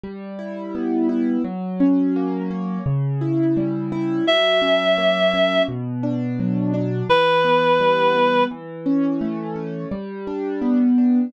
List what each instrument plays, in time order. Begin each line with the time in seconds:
0.04 acoustic grand piano G3
0.39 acoustic grand piano E4
0.75 acoustic grand piano B3
1.09 acoustic grand piano E4
1.44 acoustic grand piano F#3
1.80 acoustic grand piano C#4
2.16 acoustic grand piano A#3
2.51 acoustic grand piano C#4
2.86 acoustic grand piano C#3
3.21 acoustic grand piano E4
3.57 acoustic grand piano G3
3.92 acoustic grand piano E4
4.27 acoustic grand piano F#3, clarinet E5
4.62 acoustic grand piano C#4
4.98 acoustic grand piano A#3
5.34 acoustic grand piano C#4
5.68 acoustic grand piano B2
6.03 acoustic grand piano D4
6.40 acoustic grand piano F#3
6.74 acoustic grand piano D4
7.09 acoustic grand piano E3, clarinet B4
7.45 acoustic grand piano B3
7.80 acoustic grand piano G3
8.15 acoustic grand piano B3
8.51 acoustic grand piano E3
8.86 acoustic grand piano C#4
9.21 acoustic grand piano A3
9.56 acoustic grand piano C#4
9.91 acoustic grand piano G3
10.27 acoustic grand piano D4
10.62 acoustic grand piano B3
10.98 acoustic grand piano D4